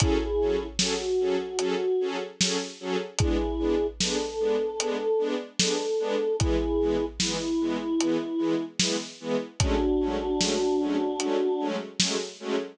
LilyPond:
<<
  \new Staff \with { instrumentName = "Choir Aahs" } { \time 4/4 \key fis \minor \tempo 4 = 75 <e' gis'>4 fis'2 r4 | <e' gis'>4 a'2 a'4 | <e' gis'>4 e'2 r4 | <d' fis'>2. r4 | }
  \new Staff \with { instrumentName = "String Ensemble 1" } { \time 4/4 \key fis \minor <fis cis' gis' a'>8 <fis cis' gis' a'>8 <fis cis' gis' a'>8 <fis cis' gis' a'>8 <fis cis' gis' a'>8 <fis cis' gis' a'>8 <fis cis' gis' a'>8 <fis cis' gis' a'>8 | <gis b d'>8 <gis b d'>8 <gis b d'>8 <gis b d'>8 <gis b d'>8 <gis b d'>8 <gis b d'>8 <gis b d'>8 | <e gis b>8 <e gis b>8 <e gis b>8 <e gis b>8 <e gis b>8 <e gis b>8 <e gis b>8 <e gis b>8 | <fis gis a cis'>8 <fis gis a cis'>8 <fis gis a cis'>8 <fis gis a cis'>8 <fis gis a cis'>8 <fis gis a cis'>8 <fis gis a cis'>8 <fis gis a cis'>8 | }
  \new DrumStaff \with { instrumentName = "Drums" } \drummode { \time 4/4 <hh bd>4 sn4 hh4 sn4 | <hh bd>4 sn4 hh4 sn4 | <hh bd>4 sn4 hh4 sn4 | <hh bd>4 sn4 hh4 sn4 | }
>>